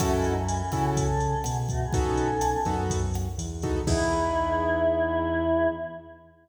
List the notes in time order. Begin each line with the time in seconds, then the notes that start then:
0.00 F#2 A3 C#4 E4 F#4 A4, kick, cross-stick, closed hi-hat
0.12 G#3 E4
0.24 F#3 D#4, closed hi-hat
0.36 E3 C#4
0.48 closed hi-hat
0.72 C#3 C#4 E4 F#4 A4, kick, cross-stick, closed hi-hat
0.97 C#4 A4, kick, closed hi-hat
1.20 closed hi-hat
1.44 B2 B3 G#4, cross-stick, closed hi-hat
1.69 A3 F#4, kick, closed hi-hat
1.82 B3 G#4
1.93 B1 B3 C#4 D#4 F#4 A4, kick, closed hi-hat
2.17 closed hi-hat
2.41 cross-stick, closed hi-hat
2.65 F#2 B3 D#4 F#4 A4, kick, closed hi-hat
2.90 kick, closed hi-hat
3.14 cross-stick, closed hi-hat
3.38 E2, closed hi-hat
3.62 B3 D#4 F#4 A4, kick, closed hi-hat
3.87 E2 B3 D#4 E4 G#4, kick, crash